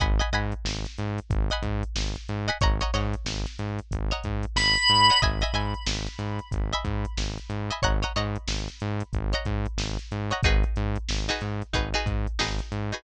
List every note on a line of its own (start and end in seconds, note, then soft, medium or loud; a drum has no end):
0.00 0.21 G#1 loud
0.00 0.16 D#5 medium
0.00 0.16 F#5 medium
0.00 0.16 G#5 medium
0.00 0.16 B5 medium
0.00 kick loud
0.00 closed hi-hat loud
0.19 0.29 D#5 medium
0.19 0.29 F#5 medium
0.19 0.29 G#5 medium
0.19 0.29 B5 medium
0.19 closed hi-hat medium
0.33 0.54 G#2 medium
0.33 0.88 D#5 medium
0.33 0.88 F#5 medium
0.33 0.88 G#5 medium
0.33 0.88 B5 medium
0.33 closed hi-hat medium
0.52 closed hi-hat medium
0.65 0.86 G#1 medium
0.65 snare loud
0.85 snare medium
0.85 closed hi-hat medium
0.98 1.20 G#2 loud
0.98 closed hi-hat medium
1.18 closed hi-hat medium
1.30 1.51 G#1 loud
1.30 kick loud
1.30 closed hi-hat loud
1.50 2.00 D#5 medium
1.50 2.00 F#5 medium
1.50 2.00 G#5 medium
1.50 2.00 B5 medium
1.50 closed hi-hat medium
1.62 1.84 G#2 loud
1.62 kick medium
1.62 closed hi-hat medium
1.83 closed hi-hat medium
1.95 2.17 G#1 medium
1.95 snare loud
2.15 snare soft
2.15 closed hi-hat medium
2.29 2.50 G#2 loud
2.29 closed hi-hat medium
2.48 2.58 D#5 medium
2.48 2.58 F#5 medium
2.48 2.58 G#5 medium
2.48 2.58 B5 medium
2.48 closed hi-hat medium
2.61 2.83 G#1 loud
2.61 2.77 C#5 medium
2.61 2.77 D#5 medium
2.61 2.77 F#5 medium
2.61 2.77 A#5 medium
2.61 kick loud
2.61 closed hi-hat loud
2.80 2.91 C#5 medium
2.80 2.91 D#5 medium
2.80 2.91 F#5 medium
2.80 2.91 A#5 medium
2.80 closed hi-hat medium
2.93 3.15 G#2 loud
2.93 3.49 C#5 medium
2.93 3.49 D#5 medium
2.93 3.49 F#5 medium
2.93 3.49 A#5 medium
2.93 snare soft
2.93 closed hi-hat medium
3.13 closed hi-hat medium
3.25 3.46 G#1 medium
3.25 snare loud
3.46 snare medium
3.46 closed hi-hat medium
3.59 3.80 G#2 medium
3.59 closed hi-hat medium
3.79 closed hi-hat medium
3.91 4.12 G#1 medium
3.91 kick medium
3.91 closed hi-hat loud
4.11 4.60 C#5 medium
4.11 4.60 D#5 medium
4.11 4.60 F#5 medium
4.11 4.60 A#5 medium
4.11 closed hi-hat medium
4.24 4.46 G#2 medium
4.24 kick medium
4.24 closed hi-hat medium
4.43 closed hi-hat medium
4.56 4.77 G#1 loud
4.56 5.20 B5 medium
4.56 snare loud
4.76 closed hi-hat medium
4.89 5.10 G#2 loud
4.89 closed hi-hat medium
5.10 5.20 C#5 medium
5.10 5.20 D#5 medium
5.10 5.20 F#5 medium
5.10 5.20 A#5 medium
5.10 closed hi-hat medium
5.22 5.43 G#1 loud
5.22 5.38 D#5 medium
5.22 5.38 E5 medium
5.22 5.38 G#5 medium
5.22 5.38 B5 medium
5.22 kick loud
5.22 closed hi-hat loud
5.41 5.52 D#5 medium
5.41 5.52 E5 medium
5.41 5.52 G#5 medium
5.41 5.52 B5 medium
5.41 closed hi-hat medium
5.53 5.74 G#2 medium
5.53 6.09 D#5 medium
5.53 6.09 E5 medium
5.53 6.09 G#5 medium
5.53 6.09 B5 medium
5.53 closed hi-hat medium
5.74 closed hi-hat medium
5.86 6.08 G#1 medium
5.86 snare loud
6.06 snare medium
6.06 closed hi-hat medium
6.19 6.40 G#2 medium
6.19 closed hi-hat medium
6.39 closed hi-hat medium
6.51 6.73 G#1 medium
6.51 kick medium
6.51 closed hi-hat loud
6.73 7.22 D#5 medium
6.73 7.22 E5 medium
6.73 7.22 G#5 medium
6.73 7.22 B5 medium
6.73 closed hi-hat medium
6.85 7.06 G#2 medium
6.85 kick medium
6.85 closed hi-hat medium
7.05 closed hi-hat medium
7.17 7.39 G#1 medium
7.17 snare loud
7.38 closed hi-hat medium
7.49 7.71 G#2 medium
7.49 closed hi-hat medium
7.70 7.81 D#5 medium
7.70 7.81 E5 medium
7.70 7.81 G#5 medium
7.70 7.81 B5 medium
7.70 closed hi-hat medium
7.82 8.04 G#1 loud
7.82 7.99 C#5 medium
7.82 7.99 D#5 medium
7.82 7.99 F#5 medium
7.82 7.99 A#5 medium
7.82 kick medium
7.82 closed hi-hat loud
8.02 8.13 C#5 medium
8.02 8.13 D#5 medium
8.02 8.13 F#5 medium
8.02 8.13 A#5 medium
8.02 closed hi-hat medium
8.16 8.37 G#2 loud
8.16 8.71 C#5 medium
8.16 8.71 D#5 medium
8.16 8.71 F#5 medium
8.16 8.71 A#5 medium
8.16 closed hi-hat medium
8.36 closed hi-hat medium
8.48 8.69 G#1 medium
8.48 snare loud
8.68 snare soft
8.68 closed hi-hat medium
8.80 9.03 G#2 loud
8.80 closed hi-hat medium
9.00 closed hi-hat medium
9.13 9.34 G#1 loud
9.13 kick medium
9.13 closed hi-hat medium
9.33 9.82 C#5 medium
9.33 9.82 D#5 medium
9.33 9.82 F#5 medium
9.33 9.82 A#5 medium
9.33 closed hi-hat medium
9.45 9.67 G#2 loud
9.45 kick medium
9.45 closed hi-hat medium
9.65 closed hi-hat medium
9.77 9.98 G#1 loud
9.77 snare loud
9.99 snare soft
9.99 closed hi-hat medium
10.11 10.33 G#2 medium
10.11 closed hi-hat medium
10.31 10.41 C#5 medium
10.31 10.41 D#5 medium
10.31 10.41 F#5 medium
10.31 10.41 A#5 medium
10.31 closed hi-hat medium
10.43 10.64 G#1 loud
10.43 10.99 D#4 medium
10.43 10.99 F#4 medium
10.43 10.99 G#4 medium
10.43 10.99 B4 medium
10.43 kick loud
10.43 closed hi-hat loud
10.63 closed hi-hat medium
10.76 10.98 G#2 loud
10.76 closed hi-hat medium
10.96 closed hi-hat medium
11.09 11.30 G#1 medium
11.09 snare loud
11.28 11.66 D#4 medium
11.28 11.66 F#4 medium
11.28 11.66 G#4 medium
11.28 11.66 B4 medium
11.28 snare medium
11.28 closed hi-hat medium
11.41 11.63 G#2 medium
11.41 closed hi-hat medium
11.62 closed hi-hat medium
11.73 11.94 G#1 medium
11.73 11.89 D#4 medium
11.73 11.89 F#4 medium
11.73 11.89 G#4 medium
11.73 11.89 B4 medium
11.73 kick medium
11.73 closed hi-hat loud
11.94 12.31 D#4 medium
11.94 12.31 F#4 medium
11.94 12.31 G#4 medium
11.94 12.31 B4 medium
11.94 closed hi-hat medium
12.06 12.27 G#2 medium
12.06 kick medium
12.06 closed hi-hat medium
12.27 closed hi-hat medium
12.39 12.61 G#1 medium
12.39 12.80 D#4 medium
12.39 12.80 F#4 medium
12.39 12.80 G#4 medium
12.39 12.80 B4 medium
12.39 snare loud
12.59 closed hi-hat medium
12.72 12.93 G#2 medium
12.72 closed hi-hat medium
12.92 13.02 D#4 medium
12.92 13.02 F#4 medium
12.92 13.02 G#4 medium
12.92 13.02 B4 medium
12.92 closed hi-hat medium